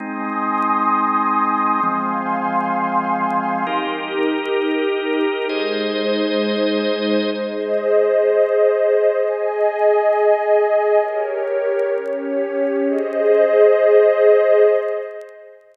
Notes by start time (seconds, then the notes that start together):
0.00 G#3 C4 D#4 G#5 C6 D#6
1.82 F3 G#3 C4 F5 G#5 C6
3.66 D#4 G4 A#4
5.49 G#3 D#4 G#4 C5 D#5
7.33 G#4 C5 D#5
9.16 G#4 D#5 G#5
10.98 G4 A#4 C#5
11.91 C#4 G4 C#5
12.83 G#4 C5 D#5